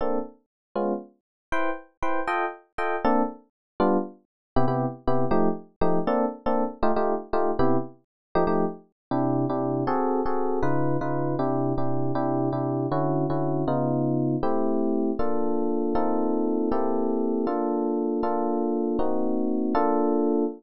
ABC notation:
X:1
M:6/8
L:1/8
Q:3/8=158
K:Bblyd
V:1 name="Electric Piano 1"
[B,CDA]6 | [_A,_C_DF]6 | [E=Bcg]4 [EBcg]2 | [FA_eg]4 [FAeg]2 |
[B,CDA]6 | [G,=B,DF]6 | [C,=B,EG] [C,B,EG]3 [C,B,EG]2 | [F,A,_EG]4 [F,A,EG]2 |
[B,CDA]3 [B,CDA]3 | [A,_EFG] [A,EFG]3 [A,EFG]2 | [C,=B,EG]6 | [F,A,_EG] [F,A,EG]5 |
[K:Clyd] [C,DEG]3 [C,DEG]3 | [C_G_A=A]3 [CG_A=A]3 | [_D,_E=F_c]3 [D,EFc]3 | [C,DEG]3 [C,DEG]3 |
[C,DEG]3 [C,DEG]3 | [D,^CEF]3 [D,CEF]3 | [_D,_C_E=F]6 | [A,CEG]6 |
[K:Bblyd] [B,DFA]6 | [B,C_EFA]6 | [B,CEGA]6 | [B,DFA]6 |
[B,DFA]6 | [B,C_E_G]6 | [B,DFA]6 |]